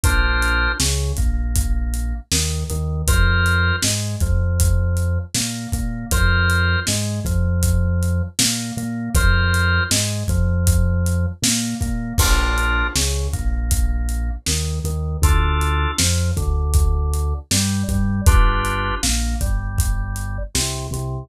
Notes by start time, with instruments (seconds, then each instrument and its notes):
0.03 synth bass 1 A#1, drawbar organ D4 F4 A#4 C5, kick, closed hi-hat
0.42 closed hi-hat
0.80 synth bass 1 C#2, drawbar organ C#3, snare
1.17 synth bass 1 A#1, drawbar organ A#3, kick, closed hi-hat
1.56 kick, closed hi-hat
1.94 closed hi-hat
2.32 synth bass 1 D#2, drawbar organ D#3, snare
2.70 synth bass 1 D#2, drawbar organ D#3, closed hi-hat
3.07 synth bass 1 F2, drawbar organ F4 A#4 C5, kick, closed hi-hat
3.46 closed hi-hat
3.82 synth bass 1 G#2, drawbar organ G#3, snare
4.20 synth bass 1 F2, drawbar organ F3, kick, closed hi-hat
4.60 kick, closed hi-hat
4.97 closed hi-hat
5.34 synth bass 1 A#2, drawbar organ A#3, snare
5.72 synth bass 1 A#2, drawbar organ A#3, kick, closed hi-hat
6.11 synth bass 1 F2, drawbar organ F4 A#4 C5, kick, closed hi-hat
6.50 closed hi-hat
6.87 synth bass 1 G#2, drawbar organ G#3, snare
7.24 synth bass 1 F2, drawbar organ F3, kick, closed hi-hat
7.63 kick, closed hi-hat
8.03 closed hi-hat
8.39 synth bass 1 A#2, drawbar organ A#3, snare
8.77 synth bass 1 A#2, drawbar organ A#3, closed hi-hat
9.15 synth bass 1 F2, drawbar organ F4 A#4 C5, kick, closed hi-hat
9.54 closed hi-hat
9.91 synth bass 1 G#2, drawbar organ G#3, snare
10.28 synth bass 1 F2, drawbar organ F3, kick, closed hi-hat
10.67 kick, closed hi-hat
11.06 closed hi-hat
11.42 synth bass 1 A#2, drawbar organ A#3, snare
11.81 synth bass 1 A#2, drawbar organ A#3, kick, closed hi-hat
12.18 synth bass 1 A#1, drawbar organ D4 F4 A#4, kick, crash
12.58 closed hi-hat
12.95 synth bass 1 C#2, drawbar organ C#3, snare
13.33 synth bass 1 A#1, drawbar organ A#3, kick, closed hi-hat
13.71 kick, closed hi-hat
14.09 closed hi-hat
14.46 synth bass 1 D#2, drawbar organ D#3, snare
14.84 synth bass 1 D#2, drawbar organ D#3, closed hi-hat
15.22 synth bass 1 D2, drawbar organ D4 F4 A4, kick, closed hi-hat
15.61 closed hi-hat
15.98 synth bass 1 F2, drawbar organ F3, snare
16.37 synth bass 1 D2, drawbar organ D3, kick, closed hi-hat
16.74 kick, closed hi-hat
17.13 closed hi-hat
17.51 synth bass 1 G2, drawbar organ G3, snare
17.88 synth bass 1 G2, drawbar organ G3, kick, closed hi-hat
18.26 synth bass 1 G1, drawbar organ D4 F4 G4 B4, kick, closed hi-hat
18.65 closed hi-hat
19.03 synth bass 1 A#1, drawbar organ A#3, snare
19.41 synth bass 1 G1, drawbar organ G3, kick, closed hi-hat
19.78 kick, closed hi-hat
20.16 closed hi-hat
20.54 synth bass 1 C2, drawbar organ C3, snare
20.91 synth bass 1 C2, drawbar organ C3, closed hi-hat